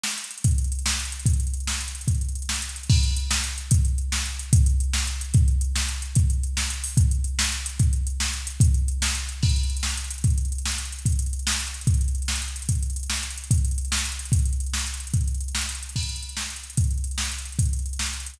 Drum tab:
CC |------|------------|------------|------------|
HH |-xxxxx|xxxxxx-xxxxx|xxxxxx-xxxxx|xxxxxx-xxxxx|
SD |o-----|------o-----|------o-----|------o-----|
BD |------|o-----------|o-----------|o-----------|

CC |x-----------|------------|------------|------------|
HH |--x-x---x-x-|x-x-x---x-x-|x-x-x---x-x-|x-x-x---x-x-|
SD |------o-----|------o-----|------o-----|------o-----|
BD |o-----------|o-----------|o-----------|o-----------|

CC |------------|------------|------------|------------|
HH |x-x-x---x-o-|x-x-x---x-x-|x-x-x---x-x-|x-x-x---x-x-|
SD |------o-----|------o-----|------o-----|------o-----|
BD |o-----------|o-----------|o-----------|o-----------|

CC |x-----------|------------|------------|------------|
HH |-xxxxx-xxxxx|xxxxxx-xxxxx|xxxxxx-xxxxx|xxxxxx-xxxxx|
SD |------o-----|------o-----|------o-----|------o-----|
BD |o-----------|o-----------|o-----------|o-----------|

CC |------------|------------|------------|------------|
HH |xxxxxx-xxxxx|xxxxxx-xxxxx|xxxxxx-xxxxx|xxxxxx-xxxxx|
SD |------o-----|------o-----|------o-----|------o-----|
BD |o-----------|o-----------|o-----------|o-----------|

CC |x-----------|------------|------------|
HH |-xxxxx-xxxxx|xxxxxx-xxxxx|xxxxxx-xxxxx|
SD |------o-----|------o-----|------o-----|
BD |o-----------|o-----------|o-----------|